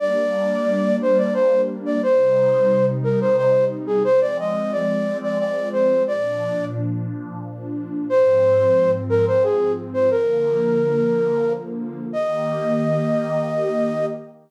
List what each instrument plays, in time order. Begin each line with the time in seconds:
0.00 pad 2 (warm) G3 A#3 D4, flute D5
1.02 flute C5
1.18 flute D5
1.34 flute C5
1.86 flute D5
2.02 pad 2 (warm) C3 G3 D#4, flute C5
3.04 flute A#4
3.21 flute C5
3.37 flute C5
3.87 flute G#4
4.04 pad 2 (warm) F3 G#3 C4, flute C5
4.21 flute D5
4.39 flute D#5
4.72 flute D5
5.23 flute D5
5.39 flute D5
5.73 flute C5
6.07 pad 2 (warm) A#2 F3 D4, flute D5
8.10 pad 2 (warm) G#2 F3 C4, flute C5
9.09 flute A#4
9.27 flute C5
9.44 flute G#4
9.94 flute C5
10.11 pad 2 (warm) D3 F3 A#3, flute A#4
12.13 pad 2 (warm) D#3 A#3 G4, flute D#5